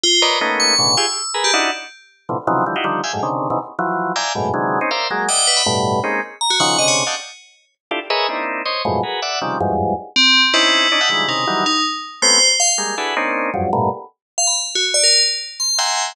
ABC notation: X:1
M:3/4
L:1/16
Q:1/4=160
K:none
V:1 name="Drawbar Organ"
z2 [_B=B_d=d_e]2 | [A,_B,=B,_D_E]4 [A,,B,,_D,=D,]2 [FG_A] z3 [A_B=B]2 | [D_E=E_G]2 z6 [A,,B,,C,D,E,F,] z [C,_D,_E,=E,F,_G,]2 | [D,E,F,G,] [_E=EF_G=G] [D,_E,F,G,]2 [=efg_a] [_G,,_A,,=A,,] [C,_D,=D,_E,]3 [B,,C,_D,E,=E,] z2 |
[E,F,_G,]4 [def=g_a_b]2 [_G,,_A,,=A,,=B,,]2 [C,D,_E,=E,G,_A,]3 [C_D_E] | [_Bcdef]2 [_G,_A,_B,]2 [d_e=e_g]4 [=G,,=A,,=B,,]4 | [_A,_B,C_D_E]2 z4 [_D,_E,F,]2 [C,D,=D,]3 [d_ef_g=g=a] | z8 [DEFGA] z [_A_B=B_d_e=e]2 |
[_B,CD_E=E]4 [c_d_e]2 [F,,_G,,_A,,=A,,=B,,]2 [_G_A_B=B]2 [=d=e_g]2 | [C,_D,_E,F,G,]2 [=E,,F,,_G,,=G,,_A,,]4 z6 | [C_D_E=E]4 [D=D_E] [_e=e_g=ga] [D,_E,=E,F,G,_A,]2 [C,_D,_E,]2 [E,=E,_G,=G,]2 | z6 [A,B,C_D]2 z4 |
[G,_A,_B,]2 [DE_G_A=A=B]2 [_B,C_D=D_E]4 [F,,_G,,=G,,]2 [G,,A,,_B,,=B,,]2 | z12 | z8 [e_g=g_a_bc']4 |]
V:2 name="Tubular Bells"
F2 z2 | z2 _d'4 e'4 z G | z12 | z12 |
z12 | z4 g2 B b z4 | z4 _b _G _g2 _e _d z2 | z12 |
z12 | z8 C3 z | E8 _E4 | _E2 z4 c3 z f z |
z12 | z5 f b z2 _G z d | _B2 z4 c'2 z4 |]